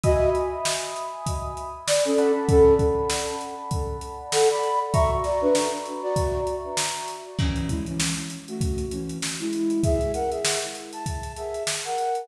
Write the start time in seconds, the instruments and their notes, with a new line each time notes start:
0.04 flute F#4 D#5, electric piano 1 E5 G#5 B5 D#6, kick, closed hi-hat
0.35 closed hi-hat
0.65 snare
0.96 closed hi-hat
1.26 kick, closed hi-hat
1.57 closed hi-hat
1.87 flute D5, snare
2.05 flute C#4 A4
2.18 electric piano 1 D5 F#5 A5 B5, closed hi-hat
2.49 flute C#4 A4, kick, closed hi-hat
2.79 kick, closed hi-hat
3.10 snare
3.41 closed hi-hat
3.71 kick, closed hi-hat
4.01 closed hi-hat
4.32 flute A4 F#5, snare
4.50 flute D5 B5
4.63 closed hi-hat
4.94 electric piano 1 F#4 E5 A#5 C#6, flute E5 C#6, kick, closed hi-hat
5.24 flute F#4 D5, snare, closed hi-hat
5.42 flute D4 B4
5.55 snare
5.86 closed hi-hat
6.03 flute F#4 D5
6.16 kick, closed hi-hat
6.47 closed hi-hat
6.77 snare
7.08 snare, closed hi-hat
7.39 flute E3 C#4, kick, crash
7.56 closed hi-hat
7.69 flute G#3 E4, kick, closed hi-hat
7.86 flute E3 C#4, closed hi-hat
8.00 snare
8.17 closed hi-hat
8.30 closed hi-hat
8.48 flute A3 F#4, closed hi-hat
8.61 kick, closed hi-hat
8.78 closed hi-hat
8.91 flute E3 C#4, closed hi-hat
9.09 closed hi-hat
9.22 snare
9.40 flute G#3 E4, closed hi-hat
9.53 snare, closed hi-hat
9.70 closed hi-hat
9.83 flute G#4 E5, kick, closed hi-hat
10.01 closed hi-hat
10.14 flute A#4 F#5, closed hi-hat
10.31 flute G#4 E5, closed hi-hat
10.45 snare
10.62 closed hi-hat
10.75 closed hi-hat
10.93 flute A5, closed hi-hat
11.06 kick, closed hi-hat
11.23 closed hi-hat
11.36 flute G#4 E5, closed hi-hat
11.54 closed hi-hat
11.67 snare
11.85 flute A#4 F#5, closed hi-hat
11.98 closed hi-hat
12.15 closed hi-hat